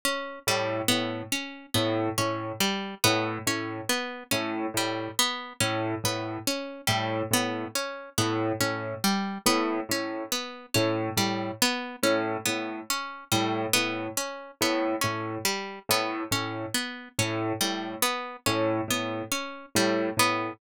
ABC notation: X:1
M:4/4
L:1/8
Q:1/4=70
K:none
V:1 name="Acoustic Grand Piano" clef=bass
z A,, A,, z A,, A,, z A,, | A,, z A,, A,, z A,, A,, z | A,, A,, z A,, A,, z A,, A,, | z A,, A,, z A,, A,, z A,, |
A,, z A,, A,, z A,, A,, z | A,, A,, z A,, A,, z A,, A,, |]
V:2 name="Harpsichord"
^C G, B, C B, C G, B, | ^C B, C G, B, C B, C | G, B, ^C B, C G, B, C | B, ^C G, B, C B, C G, |
B, ^C B, C G, B, C B, | ^C G, B, C B, C G, B, |]